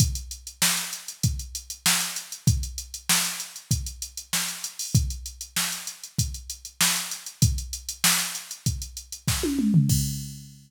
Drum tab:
CC |----------------|----------------|----------------|----------------|
HH |xxxx-xxxxxxx-xxx|xxxx-xxxxxxx-xxo|xxxx-xxxxxxx-xxx|xxxx-xxxxxxx----|
SD |----o-------o---|----o-------o---|----o-------o---|----o-------o---|
T1 |----------------|----------------|----------------|-------------o--|
T2 |----------------|----------------|----------------|--------------o-|
FT |----------------|----------------|----------------|---------------o|
BD |o-------o-------|o-------o-------|o-------o-------|o-------o---o---|

CC |x---------------|
HH |----------------|
SD |----------------|
T1 |----------------|
T2 |----------------|
FT |----------------|
BD |o---------------|